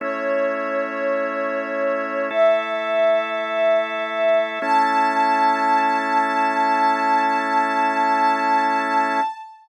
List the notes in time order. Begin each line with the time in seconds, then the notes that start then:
0.00 A3 C#4 E4 C#5
2.30 A3 E4 A4 E5
4.62 A3 C#4 E4 A5